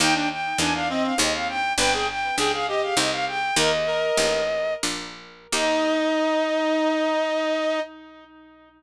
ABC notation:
X:1
M:3/4
L:1/16
Q:1/4=101
K:Eb
V:1 name="Violin"
g g g2 a f e f e f g2 | g g g2 g f e f e f g2 | "^rit." e8 z4 | e12 |]
V:2 name="Clarinet"
E D z2 D D C2 z4 | =B A z2 A A G2 z4 | "^rit." B z B4 z6 | E12 |]
V:3 name="Harpsichord"
[B,EG]4 [B,EG]4 [CEA]4 | [=B,DG]4 [B,DG]4 [CEG]4 | "^rit." [B,EG]4 [B,EG]4 [B,DF]4 | [B,EG]12 |]
V:4 name="Harpsichord" clef=bass
E,,4 =E,,4 _E,,4 | G,,,4 _D,,4 C,,4 | "^rit." E,,4 =A,,,4 B,,,4 | E,,12 |]